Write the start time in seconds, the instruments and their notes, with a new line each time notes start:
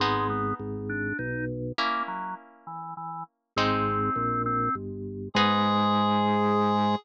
0.00 drawbar organ G#1 G#3, orchestral harp B3 D#4 G#4
0.30 drawbar organ B3
0.59 drawbar organ G#1
0.89 drawbar organ D4
1.19 drawbar organ B1 D#4
1.78 orchestral harp A#3 C#4 E4, drawbar organ A#3
2.08 drawbar organ F#3
2.67 drawbar organ E3
2.97 drawbar organ E3
3.56 drawbar organ G#1 C4, orchestral harp G#3 C4 D#4
4.16 drawbar organ A#1
4.46 drawbar organ C4
4.75 drawbar organ G1
5.34 drawbar organ G#2 G#3, orchestral harp B3 D#4 G#4, clarinet G#4